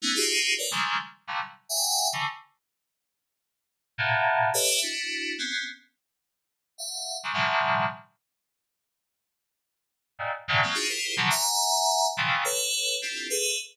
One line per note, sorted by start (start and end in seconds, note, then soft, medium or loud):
0.02 0.14 A3 medium
0.02 0.14 B3 medium
0.02 0.14 C#4 medium
0.02 0.14 D#4 medium
0.15 0.53 D#4 medium
0.15 0.53 F4 medium
0.15 0.53 F#4 medium
0.15 0.53 G4 medium
0.15 0.53 G#4 medium
0.58 0.71 A#4 medium
0.58 0.71 B4 medium
0.58 0.71 C#5 medium
0.58 0.71 D5 medium
0.71 0.97 C#3 medium
0.71 0.97 D#3 medium
0.71 0.97 F3 medium
0.71 0.97 G3 medium
0.71 0.97 G#3 medium
0.71 0.97 A3 medium
1.27 1.40 A#2 medium
1.27 1.40 C3 medium
1.27 1.40 D3 medium
1.27 1.40 E3 medium
1.27 1.40 F#3 medium
1.27 1.40 G3 medium
1.69 2.07 E5 loud
1.69 2.07 F#5 loud
1.69 2.07 G5 loud
1.69 2.07 G#5 loud
2.13 2.26 C#3 medium
2.13 2.26 D3 medium
2.13 2.26 E3 medium
3.98 4.49 A2 loud
3.98 4.49 A#2 loud
3.98 4.49 B2 loud
4.54 4.79 G4 loud
4.54 4.79 A4 loud
4.54 4.79 B4 loud
4.54 4.79 C#5 loud
4.54 4.79 D#5 loud
4.54 4.79 E5 loud
4.82 5.33 D4 medium
4.82 5.33 E4 medium
4.82 5.33 F#4 medium
5.38 5.64 B3 medium
5.38 5.64 C4 medium
5.38 5.64 C#4 medium
6.78 7.16 E5 medium
6.78 7.16 F5 medium
6.78 7.16 F#5 medium
7.23 7.33 C#3 medium
7.23 7.33 D#3 medium
7.23 7.33 F3 medium
7.23 7.36 F#3 medium
7.23 7.33 G3 medium
7.33 7.84 A2 medium
7.33 7.84 B2 medium
7.33 7.84 C#3 medium
7.33 7.84 D#3 medium
7.33 7.84 F3 medium
7.33 7.84 G3 medium
10.19 10.31 G2 medium
10.19 10.31 G#2 medium
10.19 10.31 A#2 medium
10.48 10.61 G2 loud
10.48 10.61 A2 loud
10.48 10.61 B2 loud
10.48 10.61 C#3 loud
10.48 10.61 D#3 loud
10.63 10.75 F#3 medium
10.63 10.75 G#3 medium
10.63 10.75 A#3 medium
10.63 10.75 C4 medium
10.74 10.87 D4 medium
10.74 10.87 D#4 medium
10.74 10.87 F4 medium
10.74 10.87 F#4 medium
10.74 10.87 G#4 medium
10.89 11.14 E4 medium
10.89 11.14 F4 medium
10.89 11.14 G4 medium
10.89 11.14 G#4 medium
10.89 11.14 A#4 medium
10.89 11.14 C5 medium
11.17 11.29 B2 medium
11.17 11.29 C#3 medium
11.17 11.29 D3 medium
11.17 11.29 D#3 medium
11.17 11.29 F3 medium
11.17 11.29 F#3 medium
11.30 12.07 E5 loud
11.30 12.07 F#5 loud
11.30 12.07 G#5 loud
11.30 12.07 A#5 loud
12.17 12.42 A#2 medium
12.17 12.42 C3 medium
12.17 12.42 C#3 medium
12.17 12.42 D#3 medium
12.17 12.42 E3 medium
12.17 12.42 F3 medium
12.44 12.95 A4 loud
12.44 12.95 B4 loud
12.44 12.95 C#5 loud
13.02 13.27 C4 soft
13.02 13.27 D4 soft
13.02 13.27 E4 soft
13.02 13.27 F4 soft
13.02 13.27 G4 soft
13.02 13.27 A4 soft
13.30 13.55 G#4 loud
13.30 13.55 A4 loud
13.30 13.55 B4 loud